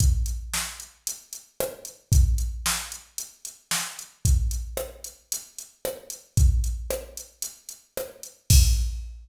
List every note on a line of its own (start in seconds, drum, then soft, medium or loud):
0.00 kick medium
0.00 closed hi-hat medium
0.26 closed hi-hat medium
0.54 snare medium
0.80 closed hi-hat medium
1.07 closed hi-hat medium
1.33 closed hi-hat medium
1.60 cross-stick loud
1.85 closed hi-hat medium
2.12 kick loud
2.12 closed hi-hat medium
2.38 closed hi-hat medium
2.66 snare loud
2.92 closed hi-hat medium
3.18 closed hi-hat medium
3.45 closed hi-hat medium
3.71 snare medium
3.99 closed hi-hat medium
4.25 kick medium
4.25 closed hi-hat medium
4.51 closed hi-hat medium
4.77 cross-stick medium
5.04 closed hi-hat medium
5.32 closed hi-hat medium
5.58 closed hi-hat medium
5.85 cross-stick loud
6.10 closed hi-hat medium
6.37 kick loud
6.37 closed hi-hat medium
6.64 closed hi-hat medium
6.90 cross-stick loud
7.17 closed hi-hat medium
7.42 closed hi-hat medium
7.69 closed hi-hat medium
7.97 cross-stick medium
8.23 closed hi-hat medium
8.50 kick loud
8.50 crash loud